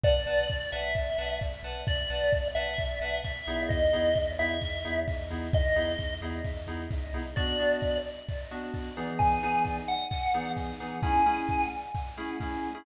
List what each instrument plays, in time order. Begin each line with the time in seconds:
0.04 synth bass 2 B1, electric piano 2 B4 D5 F#5 A5, lead 1 (square) D5, kick
0.26 synth bass 2 B1, electric piano 2 B4 D5 F#5 A5
0.49 synth bass 2 B1, kick
0.72 synth bass 2 B1, electric piano 2 B4 D5 F#5 A5, lead 1 (square) E5
0.95 synth bass 2 B1, kick
1.18 synth bass 2 B1, electric piano 2 B4 D5 F#5 A5
1.41 synth bass 2 B1, kick
1.63 synth bass 2 B1, electric piano 2 B4 D5 F#5 A5
1.87 synth bass 2 B1, lead 1 (square) D5, kick
2.10 synth bass 2 B1, electric piano 2 B4 D5 F#5 A5
2.32 synth bass 2 B1, kick
2.55 synth bass 2 B1, electric piano 2 B4 D5 F#5 A5, lead 1 (square) E5
2.78 synth bass 2 B1, kick
3.00 synth bass 2 B1, electric piano 2 B4 D5 F#5 A5
3.24 synth bass 2 B1, lead 1 (square) E5, kick
3.47 synth bass 2 B1, electric piano 2 B3 D#4 E4 G#4
3.69 synth bass 2 E2, lead 1 (square) D#5, kick
3.93 synth bass 2 E2, electric piano 2 B3 D#4 E4 G#4
4.16 synth bass 2 E2, kick
4.39 synth bass 2 E2, electric piano 2 B3 D#4 E4 G#4, lead 1 (square) E5
4.62 synth bass 2 E2, kick
4.85 synth bass 2 E2, electric piano 2 B3 D#4 E4 G#4
5.08 synth bass 2 E2, kick
5.30 synth bass 2 E2, electric piano 2 B3 D#4 E4 G#4
5.53 synth bass 2 E2, lead 1 (square) D#5, kick
5.75 synth bass 2 E2, electric piano 2 B3 D#4 E4 G#4
5.98 synth bass 2 E2, kick
6.21 synth bass 2 E2, electric piano 2 B3 D#4 E4 G#4
6.44 synth bass 2 E2, kick
6.67 synth bass 2 E2, electric piano 2 B3 D#4 E4 G#4
6.90 synth bass 2 C#2, kick
7.13 synth bass 2 C2, electric piano 2 B3 D#4 E4 G#4
7.36 electric piano 2 B3 D4 F#4, lead 1 (square) D5, kick
7.59 electric piano 2 B3 D4 F#4
7.82 kick
8.29 kick
8.51 electric piano 2 B3 D4 F#4
8.74 kick
8.97 electric piano 2 E3 B3 D#4 G#4
9.19 lead 1 (square) G#5, kick
9.43 electric piano 2 E3 B3 D#4 G#4
9.65 kick
9.88 lead 1 (square) F#5
10.11 kick
10.34 electric piano 2 E3 B3 D#4 G#4
10.57 kick
10.80 electric piano 2 E3 B3 D#4 G#4
11.02 electric piano 2 A3 C#4 E4 G#4, lead 1 (square) G#5, kick
11.26 electric piano 2 A3 C#4 E4 G#4
11.49 kick
11.95 kick
12.17 electric piano 2 A3 C#4 E4 G#4
12.40 electric piano 2 A3 C#4 E4 G#4, kick
12.75 electric piano 2 A3 C#4 E4 G#4